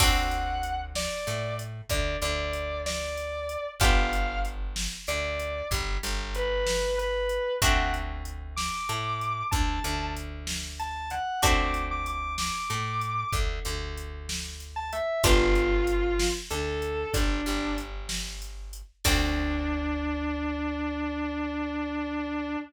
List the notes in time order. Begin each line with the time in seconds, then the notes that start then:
0.00 D2 C4 D4 F#4 A4 F#5, kick, crash
0.31 closed hi-hat
0.63 closed hi-hat
0.95 D5, snare
1.27 A2 A3, closed hi-hat
1.59 closed hi-hat
1.89 D2 D3 D5, kick, closed hi-hat
2.22 D2 D3 D5, closed hi-hat
2.53 closed hi-hat
2.86 D5, snare
3.17 closed hi-hat
3.49 closed hi-hat
3.80 G1 B3 D4 F4 G4 F5, kick, closed hi-hat
4.13 closed hi-hat
4.45 closed hi-hat
4.76 snare
5.07 D2 D3 D5, closed hi-hat
5.40 closed hi-hat
5.71 G1 G3, kick, closed hi-hat
6.03 G1 G3, closed hi-hat
6.35 B4, closed hi-hat
6.67 snare
6.98 B4, closed hi-hat
7.29 closed hi-hat
7.62 D2 A3 C4 D4 F#4 F#5, kick, closed hi-hat
7.94 closed hi-hat
8.25 closed hi-hat
8.56 D6, snare
8.89 A2 A3, closed hi-hat
9.21 closed hi-hat
9.51 D2 D3 A5, kick, closed hi-hat
9.84 D2 D3, closed hi-hat
10.17 closed hi-hat
10.47 snare
10.79 A5, closed hi-hat
11.10 F#5, closed hi-hat
11.42 D2 A3 C4 D4 F#4 D6, kick, closed hi-hat
11.74 closed hi-hat
11.91 D6
12.06 D6, closed hi-hat
12.38 D6, snare
12.70 A2 A3, closed hi-hat
13.01 closed hi-hat
13.33 D2 D3, kick, closed hi-hat
13.65 D2 D3, closed hi-hat
13.97 closed hi-hat
14.29 snare
14.60 closed hi-hat
14.76 A5
14.93 E5, closed hi-hat
15.23 G1 B3 D4 F4 G4, kick, closed hi-hat
15.55 closed hi-hat
15.87 closed hi-hat
16.19 snare
16.50 D2 D3 A4, closed hi-hat
16.82 closed hi-hat
17.14 G1 G3 D4, kick, closed hi-hat
17.46 G1 G3, closed hi-hat
17.78 closed hi-hat
18.09 snare
18.42 closed hi-hat
18.73 closed hi-hat
19.04 D2 C4 D4 F#4 A4, kick, crash